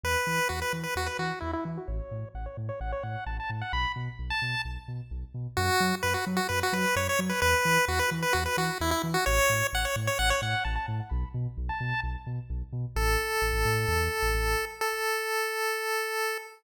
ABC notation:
X:1
M:4/4
L:1/16
Q:1/4=130
K:F#phr
V:1 name="Lead 1 (square)"
B4 F B z B F B F2 E E z F | c4 f c z c f c f2 a a z f | b2 z3 a3 z8 | F4 B F z F B F B2 c c z B |
B4 F B z B F B F2 E E z F | c4 f c z c f c f2 a a z f | b2 z3 a3 z8 | [K:Aphr] A16 |
A16 |]
V:2 name="Synth Bass 2" clef=bass
E,,2 E,2 E,,2 E,2 E,,2 E,2 E,,2 E,2 | A,,,2 A,,2 A,,,2 A,,2 A,,,2 A,,2 A,,,2 A,,2 | B,,,2 B,,2 B,,,2 B,,2 B,,,2 B,,2 B,,,2 B,,2 | F,,2 F,2 F,,2 F,2 F,,2 F,2 F,,2 F,2 |
E,,2 E,2 E,,2 E,2 E,,2 E,2 E,,2 E,2 | A,,,2 A,,2 A,,,2 A,,2 A,,,2 A,,2 A,,,2 A,,2 | B,,,2 B,,2 B,,,2 B,,2 B,,,2 B,,2 B,,,2 B,,2 | [K:Aphr] A,,,4 A,,, A,,, A,,2 E,,3 A,,, A,,,4- |
A,,,16 |]